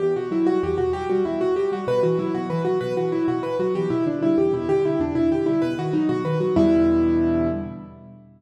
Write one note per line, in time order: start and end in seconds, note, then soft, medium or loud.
0.00 0.14 E2 medium
0.00 0.14 G4 medium
0.16 0.30 B2 medium
0.16 0.31 F#4 medium
0.31 0.45 F#3 medium
0.31 0.46 E4 medium
0.47 0.62 G3 medium
0.47 0.61 F#4 medium
0.63 0.77 E2 medium
0.63 0.78 G4 medium
0.78 0.93 B2 medium
0.78 0.92 F#4 medium
0.93 1.08 F#3 medium
0.93 1.08 G4 medium
1.10 1.24 G3 medium
1.10 1.24 F#4 medium
1.25 1.39 E2 medium
1.25 1.40 E4 medium
1.41 1.55 B2 medium
1.41 1.55 F#4 medium
1.56 1.70 F#3 medium
1.56 1.71 G4 medium
1.72 1.86 G3 medium
1.72 1.87 F#4 medium
1.87 2.01 B2 medium
1.87 2.02 B4 medium
2.03 2.17 E3 medium
2.03 2.18 F#4 medium
2.19 2.33 F#3 medium
2.19 2.33 E4 medium
2.34 2.48 B2 medium
2.34 2.49 F#4 medium
2.50 2.64 E3 medium
2.50 2.64 B4 medium
2.65 2.80 F#3 medium
2.65 2.79 F#4 medium
2.81 2.95 B2 medium
2.81 2.95 B4 medium
2.96 3.11 E3 medium
2.96 3.11 F#4 medium
3.12 3.27 F#3 medium
3.12 3.26 E4 medium
3.28 3.42 B2 medium
3.28 3.42 F#4 medium
3.43 3.58 E3 medium
3.43 3.57 B4 medium
3.59 3.73 F#3 medium
3.59 3.74 F#4 medium
3.75 3.89 E2 medium
3.75 3.90 G4 medium
3.90 4.04 B2 medium
3.90 4.05 E4 medium
4.06 4.20 D3 medium
4.06 4.21 D4 medium
4.22 4.36 G3 medium
4.22 4.37 E4 medium
4.38 4.52 E2 medium
4.38 4.52 G4 medium
4.53 4.67 B2 medium
4.53 4.68 E4 medium
4.69 4.83 D3 medium
4.69 4.83 G4 medium
4.84 4.98 G3 medium
4.84 5.00 E4 medium
5.00 5.14 E2 medium
5.00 5.15 D4 medium
5.15 5.30 B2 medium
5.15 5.30 E4 medium
5.31 5.45 D3 medium
5.31 5.46 G4 medium
5.46 5.61 G3 medium
5.46 5.60 E4 medium
5.62 5.76 B2 medium
5.62 5.76 B4 medium
5.78 5.92 D#3 medium
5.78 5.93 F#4 medium
5.93 6.08 F#3 medium
5.93 6.08 D#4 medium
6.09 6.23 B2 medium
6.09 6.23 F#4 medium
6.24 6.38 D#3 medium
6.24 6.39 B4 medium
6.40 6.54 F#3 medium
6.40 6.55 F#4 medium
6.56 7.47 E2 loud
6.56 7.47 B2 loud
6.56 7.47 D3 loud
6.56 7.47 G3 loud
6.56 7.47 E4 loud